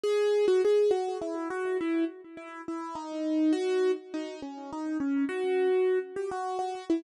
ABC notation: X:1
M:3/4
L:1/16
Q:1/4=103
K:G#m
V:1 name="Acoustic Grand Piano"
G3 F G2 F2 E2 F2 | E2 z2 E2 E2 D4 | F3 z D2 C2 D2 C2 | F6 =G F2 F2 E |]